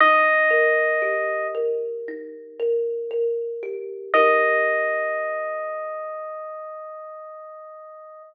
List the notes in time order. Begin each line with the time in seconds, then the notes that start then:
0.00 D#4 D#5
0.50 A#4
1.02 G4
1.55 A#4
2.08 D#4
2.59 A#4
3.11 A#4
3.63 G4
4.14 D#4 G4 A#4 D#5